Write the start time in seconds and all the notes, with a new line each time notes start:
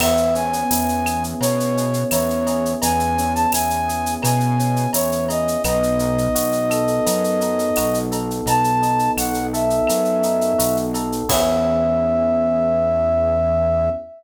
0.00 E2 B3 E5, crash, cowbell, claves
0.17 shaker
0.35 C#4 G#5, shaker
0.53 shaker
0.70 E2 E4, tambourine, shaker
0.89 shaker
1.06 G#4, claves, shaker
1.24 shaker
1.40 B2 B3 C#5, cowbell, shaker
1.60 shaker
1.76 C#4, shaker
1.94 shaker
2.11 E2 E4 C#5, tambourine, cowbell, claves, shaker
2.30 shaker
2.47 G#4, cowbell, shaker
2.65 shaker
2.82 E2 B3 G#5, cowbell, shaker
3.00 shaker
3.17 C#4, shaker
3.34 A5, shaker
3.52 E2 E4 G#5, tambourine, claves, shaker
3.70 shaker
3.88 G#4, shaker
4.06 shaker
4.22 B2 B3 G#5, cowbell, claves, shaker
4.40 shaker
4.59 C#4, shaker
4.76 shaker
4.93 E2 E4 C#5, tambourine, cowbell, shaker
5.12 shaker
5.29 G#4 D#5, cowbell, shaker
5.48 shaker
5.64 B1 B3 D#5, cowbell, claves, shaker
5.83 shaker
5.99 D#4, shaker
6.18 shaker
6.35 B1 F#4, tambourine, shaker
6.52 shaker
6.70 A4, claves, shaker
6.87 shaker
7.06 F#2 B3, cowbell, shaker
7.24 shaker
7.41 D#4, shaker
7.59 shaker
7.76 B1 F#4, tambourine, cowbell, claves, shaker
7.94 shaker
8.11 A4, cowbell, shaker
8.31 shaker
8.46 B1 B3 A5, cowbell, shaker
8.64 shaker
8.82 D#4, shaker
8.99 shaker
9.17 B1 F#4 F#5, tambourine, claves, shaker
9.34 shaker
9.53 A4 E5, shaker
9.70 shaker
9.87 F#2 B3, cowbell, claves, shaker
10.05 shaker
10.23 D#4, shaker
10.41 shaker
10.58 B1 F#4, tambourine, cowbell, shaker
10.76 shaker
10.94 A4, cowbell, shaker
11.12 shaker
11.29 E2 B3 C#4 E4 G#4 E5, kick, crash